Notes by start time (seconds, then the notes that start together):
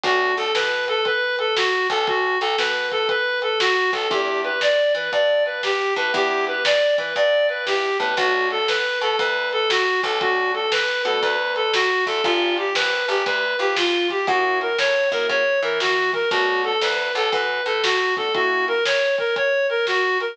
0.03 B1 A3 B3 D4 F#4, kick, closed hi-hat
0.37 B1 A4, closed hi-hat
0.55 B2 B4, snare
0.88 A4, closed hi-hat
1.05 B4, kick, closed hi-hat
1.39 A4, closed hi-hat
1.57 F#4, snare
1.90 B1 A4, kick, open hi-hat
2.07 F#4, kick, closed hi-hat
2.41 B1 A4, closed hi-hat
2.58 B2 B4, snare
2.92 A4, kick, closed hi-hat
3.09 B4, kick, closed hi-hat
3.42 A4, closed hi-hat
3.60 F#4, snare
3.93 B1 A4, kick, closed hi-hat
4.10 E2 B3 D4 E4 G4, kick, closed hi-hat
4.44 B4, closed hi-hat
4.61 D5, snare
4.95 E3 B4, closed hi-hat
5.12 G2 D5, kick, closed hi-hat
5.46 B4, closed hi-hat
5.63 G4, snare
5.96 A2 B4, kick, closed hi-hat
6.13 E2 B3 D4 E4 G4, kick, closed hi-hat
6.47 B4, closed hi-hat
6.65 D5, snare
6.98 E3 B4, kick, closed hi-hat
7.15 G2 D5, kick, closed hi-hat
7.49 B4, closed hi-hat
7.67 B3 D4 E4 G4, snare
8.00 A2 B3 D4 E4 G4 B4, kick, closed hi-hat
8.17 B1 A3 B3 D4 F#4, kick, closed hi-hat
8.51 A4, closed hi-hat
8.68 B4, snare
9.01 B2 A4, closed hi-hat
9.19 D2 B4, kick, closed hi-hat
9.52 A4, closed hi-hat
9.70 F#4, snare
10.03 B1 A4, kick, closed hi-hat
10.21 A3 B3 D4 F#4, kick, closed hi-hat
10.54 A4, closed hi-hat
10.72 B4, snare
11.05 B2 A3 B3 D4 F#4 A4, closed hi-hat
11.22 D2 B4, kick, closed hi-hat
11.56 A4, closed hi-hat
11.73 F#4, snare
12.06 E2 A4, kick, closed hi-hat
12.24 G1 B3 D4 F4 G4, kick, closed hi-hat
12.57 G4, closed hi-hat
12.75 A#1 B4, snare
13.08 G1 G4, closed hi-hat
13.26 D2 B4, kick, closed hi-hat
13.59 F2 G4, closed hi-hat
13.76 F4, snare
14.10 G4, kick, closed hi-hat
14.27 F#2 A#3 C#4 E4 F#4, kick, closed hi-hat
14.61 A#4, closed hi-hat
14.78 A2 C#5, snare
15.12 F#2 A#3 C#4 E4 F#4 A#4, kick, closed hi-hat
15.29 C#3 C#5, kick, closed hi-hat
15.62 E3 A#4, closed hi-hat
15.80 F#4, snare
16.13 A#4, kick, closed hi-hat
16.31 B1 A3 B3 D4 F#4, kick, closed hi-hat
16.64 A4, closed hi-hat
16.81 D2 B4, snare
17.15 B1 A4, closed hi-hat
17.32 F#2 B4, kick, closed hi-hat
17.66 A2 A4, closed hi-hat
17.83 F#4, snare
18.17 A3 B3 D4 F#4 A4, kick, closed hi-hat
18.35 A#3 C#4 E4 F#4, kick, closed hi-hat
18.68 A#4, closed hi-hat
18.85 C#5, snare
19.18 A#4, kick, closed hi-hat
19.36 C#5, kick, closed hi-hat
19.69 A#4, closed hi-hat
19.87 F#4, snare
20.20 A#4, closed hi-hat